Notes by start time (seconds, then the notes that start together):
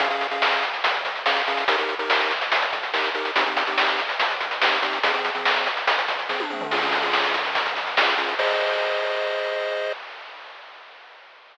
0.00 C#4 G#4 F5, kick, closed hi-hat
0.10 C#4 G#4 F5, closed hi-hat
0.21 closed hi-hat
0.31 C#4 G#4 F5, closed hi-hat
0.42 snare
0.52 closed hi-hat
0.63 closed hi-hat
0.73 closed hi-hat
0.84 kick, closed hi-hat
0.94 closed hi-hat
1.05 kick, closed hi-hat
1.15 closed hi-hat
1.26 C#4 G#4 F5, snare
1.36 closed hi-hat
1.47 C#4 G#4 F5, closed hi-hat
1.57 closed hi-hat
1.68 D#4 G4 A#4, kick, closed hi-hat
1.78 D#4 G4 A#4, closed hi-hat
1.89 closed hi-hat
1.99 D#4 G4 A#4, closed hi-hat
2.10 snare
2.20 closed hi-hat
2.31 closed hi-hat
2.41 closed hi-hat
2.52 kick, closed hi-hat
2.62 closed hi-hat
2.73 kick, closed hi-hat
2.83 closed hi-hat
2.94 D#4 G4 A#4, snare
3.04 closed hi-hat
3.15 D#4 G4 A#4, closed hi-hat
3.25 closed hi-hat
3.36 C4 D#4 G4, kick, closed hi-hat
3.46 C4 D#4 G4, closed hi-hat
3.57 closed hi-hat
3.67 C4 D#4 G4, closed hi-hat
3.78 snare
3.88 closed hi-hat
3.99 closed hi-hat
4.09 closed hi-hat
4.20 kick, closed hi-hat
4.30 closed hi-hat
4.41 kick, closed hi-hat
4.51 closed hi-hat
4.62 C4 D#4 G4, snare
4.72 closed hi-hat
4.82 C4 D#4 G4, closed hi-hat
4.93 closed hi-hat
5.03 F3 C4 G#4, kick, closed hi-hat
5.14 F3 C4 G#4, closed hi-hat
5.25 closed hi-hat
5.35 F3 C4 G#4, closed hi-hat
5.45 snare
5.56 closed hi-hat
5.66 closed hi-hat
5.77 closed hi-hat
5.87 kick, closed hi-hat
5.98 closed hi-hat
6.08 kick, closed hi-hat
6.19 closed hi-hat
6.29 F3 C4 G#4, kick, snare
6.40 high tom
6.50 F3 C4 G#4, mid tom
6.61 floor tom
6.71 C#4 F4 G#4, kick, crash
6.82 C#4 F4 G#4, closed hi-hat
6.92 closed hi-hat
7.03 C#4 F4 G#4, closed hi-hat
7.13 snare
7.24 closed hi-hat
7.34 closed hi-hat
7.45 closed hi-hat
7.55 kick, closed hi-hat
7.66 closed hi-hat
7.76 kick, closed hi-hat
7.87 closed hi-hat
7.97 C#4 F4 G#4, snare
8.08 closed hi-hat
8.18 C#4 F4 G#4, closed hi-hat
8.29 closed hi-hat
8.39 G#4 C5 D#5, kick, crash